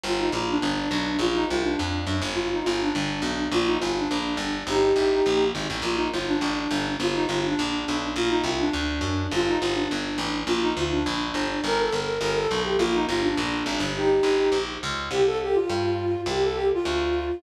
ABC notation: X:1
M:4/4
L:1/8
Q:1/4=207
K:Bb
V:1 name="Flute"
F E F D5 | F E F D5 | F E F D5 | F E F D5 |
[EG]6 z2 | F E F D5 | F E F D5 | F E F D5 |
F E F D5 | F E F D5 | B A B2 B A2 G | F E F D5 |
[EG]5 z3 | [K:C] G A G F5 | G A G F5 |]
V:2 name="Electric Bass (finger)" clef=bass
G,,,2 B,,,2 G,,,2 =B,,,2 | B,,,2 C,,2 F,,2 _G,, =G,,,- | G,,,2 G,,,2 G,,,2 =B,,,2 | B,,,2 G,,,2 B,,,2 G,,,2 |
G,,,2 A,,,2 B,,,2 _A,,, =A,,, | B,,,2 G,,,2 A,,,2 G,,,2 | G,,,2 G,,,2 B,,,2 =B,,,2 | B,,,2 C,,2 D,,2 _G,,2 |
G,,,2 G,,,2 G,,,2 A,,,2 | B,,,2 D,,2 B,,,2 G,,,2 | G,,,2 G,,,2 G,,,2 =B,,,2 | B,,,2 G,,,2 B,,,2 _A,,, G,,,- |
G,,,2 G,,,2 B,,,2 _D,,2 | [K:C] C,,4 G,,4 | C,,4 D,,4 |]